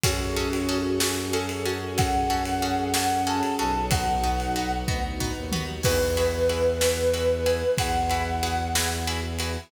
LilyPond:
<<
  \new Staff \with { instrumentName = "Flute" } { \time 6/8 \key e \major \tempo 4. = 62 fis'4. fis'8 a'8 fis'8 | fis''4. fis''8 a''8 a''8 | fis''4. r4. | b'2. |
fis''4. r4. | }
  \new Staff \with { instrumentName = "Pizzicato Strings" } { \time 6/8 \key e \major <cis' fis' gis' a'>8 <cis' fis' gis' a'>8 <cis' fis' gis' a'>8 <cis' fis' gis' a'>8 <cis' fis' gis' a'>8 <cis' fis' gis' a'>8 | <cis' fis' gis' a'>8 <cis' fis' gis' a'>8 <cis' fis' gis' a'>8 <cis' fis' gis' a'>8 <cis' fis' gis' a'>8 <cis' fis' gis' a'>8 | <b dis' fis'>8 <b dis' fis'>8 <b dis' fis'>8 <b dis' fis'>8 <b dis' fis'>8 <b dis' fis'>8 | <e' fis' gis' b'>8 <e' fis' gis' b'>8 <e' fis' gis' b'>8 <e' fis' gis' b'>8 <e' fis' gis' b'>8 <e' fis' gis' b'>8 |
<e' fis' gis' b'>8 <e' fis' gis' b'>8 <e' fis' gis' b'>8 <e' fis' gis' b'>8 <e' fis' gis' b'>8 <e' fis' gis' b'>8 | }
  \new Staff \with { instrumentName = "Violin" } { \clef bass \time 6/8 \key e \major fis,2.~ | fis,2~ fis,8 b,,8~ | b,,4. d,8. dis,8. | e,2. |
e,2. | }
  \new Staff \with { instrumentName = "String Ensemble 1" } { \time 6/8 \key e \major <cis' fis' gis' a'>2.~ | <cis' fis' gis' a'>2. | <b dis' fis'>2. | r2. |
r2. | }
  \new DrumStaff \with { instrumentName = "Drums" } \drummode { \time 6/8 <bd cymr>8. cymr8. sn8. cymr8. | <bd cymr>8. cymr8. sn8. cymr8. | <bd cymr>8. cymr8. bd8 tomfh8 toml8 | <cymc bd>8 cymr8 cymr8 sn8 cymr8 cymr8 |
<bd cymr>8 cymr8 cymr8 sn8 cymr8 cymr8 | }
>>